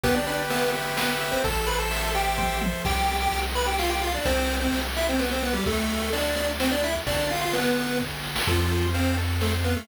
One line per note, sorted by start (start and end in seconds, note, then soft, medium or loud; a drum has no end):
0.04 1.33 G1 medium
0.04 0.15 B3 loud
0.04 0.74 G4 medium
0.04 0.15 B4 loud
0.04 kick medium
0.04 ride medium
0.15 0.26 D4 medium
0.15 0.26 D5 loud
0.26 0.38 D4 medium
0.26 0.96 B4 medium
0.26 0.38 D5 medium
0.26 ride medium
0.50 0.71 B3 medium
0.50 0.71 B4 medium
0.50 1.20 E5 medium
0.50 ride medium
0.74 1.41 G4 medium
0.74 ride medium
0.97 1.09 B3 medium
0.97 1.41 B4 medium
0.97 1.09 B4 medium
0.97 snare loud
1.20 1.43 E5 medium
1.20 ride medium
1.32 1.43 C4 medium
1.32 1.43 C5 loud
1.44 2.74 A1 medium
1.44 2.14 A4 medium
1.44 1.66 A4 medium
1.44 1.66 A5 medium
1.44 kick medium
1.44 ride medium
1.67 1.78 B4 medium
1.67 2.37 C5 medium
1.67 1.78 B5 medium
1.67 ride medium
1.78 2.08 A4 medium
1.78 2.08 A5 medium
1.91 2.61 E5 medium
1.91 ride medium
2.14 2.58 G4 medium
2.14 2.81 A4 medium
2.14 2.58 G5 medium
2.14 ride medium
2.38 2.82 C5 medium
2.38 kick medium
2.38 high tom medium
2.61 2.83 E5 medium
2.61 high tom medium
2.85 3.28 C2 medium
2.85 3.16 G4 medium
2.85 3.16 G5 loud
2.85 kick medium
2.85 crash medium
3.08 ride medium
3.21 3.40 G4 medium
3.21 3.40 G5 loud
3.32 4.18 C2 medium
3.32 ride medium
3.55 3.66 B4 medium
3.55 3.66 B5 medium
3.55 ride medium
3.66 3.77 G4 medium
3.66 3.77 G5 medium
3.79 3.90 F4 medium
3.79 3.90 F5 medium
3.79 snare medium
3.90 4.01 G4 medium
3.90 4.01 G5 medium
4.01 4.13 F4 medium
4.01 4.13 F5 medium
4.01 ride medium
4.14 4.25 D4 medium
4.14 4.25 D5 medium
4.25 4.68 C2 medium
4.25 4.56 C4 loud
4.25 4.56 C5 loud
4.25 kick medium
4.25 ride medium
4.49 ride medium
4.60 4.79 C4 medium
4.60 4.79 C5 medium
4.72 5.58 C2 medium
4.72 ride medium
4.96 5.08 E4 medium
4.96 5.08 E5 loud
4.96 ride medium
5.09 5.20 C4 medium
5.09 5.20 C5 medium
5.19 5.30 B3 medium
5.19 5.30 B4 medium
5.19 snare medium
5.31 5.42 C4 medium
5.31 5.42 C5 medium
5.43 5.54 B3 medium
5.43 5.54 B4 medium
5.43 ride medium
5.53 5.64 G3 medium
5.53 5.64 G4 loud
5.66 6.95 D2 medium
5.66 6.10 A3 medium
5.66 6.10 A4 loud
5.66 kick medium
5.66 ride medium
5.89 ride medium
6.13 6.36 D4 medium
6.13 6.36 D5 loud
6.13 ride medium
6.36 6.48 D4 medium
6.36 6.48 D5 loud
6.36 ride medium
6.60 6.71 C4 medium
6.60 6.71 C5 loud
6.60 snare medium
6.71 6.82 D4 medium
6.71 6.82 D5 loud
6.83 6.95 E4 medium
6.83 6.95 E5 loud
6.83 ride medium
7.07 8.36 G1 medium
7.07 7.27 D4 medium
7.07 7.27 D5 loud
7.07 kick medium
7.07 ride medium
7.30 7.41 F4 medium
7.30 7.41 F5 medium
7.30 ride medium
7.41 7.52 F4 medium
7.41 7.52 F5 medium
7.53 7.98 B3 medium
7.53 7.98 B4 loud
7.53 ride medium
7.77 ride medium
8.00 kick medium
8.00 snare medium
8.24 snare medium
8.36 snare loud
8.47 9.77 F2 medium
8.47 8.87 F3 medium
8.47 8.87 F4 loud
8.47 8.71 A4 medium
8.47 kick medium
8.47 crash medium
8.71 8.94 C5 medium
8.71 ride medium
8.94 9.16 C4 medium
8.94 9.16 C5 medium
8.94 9.17 F5 medium
8.94 ride medium
9.18 9.41 A4 medium
9.18 ride medium
9.41 9.52 A3 medium
9.41 9.52 A4 medium
9.41 9.65 C5 medium
9.41 snare medium
9.64 9.75 B3 medium
9.64 9.75 B4 medium
9.64 9.87 F5 medium
9.64 ride soft
9.76 9.87 A3 medium
9.76 9.87 A4 medium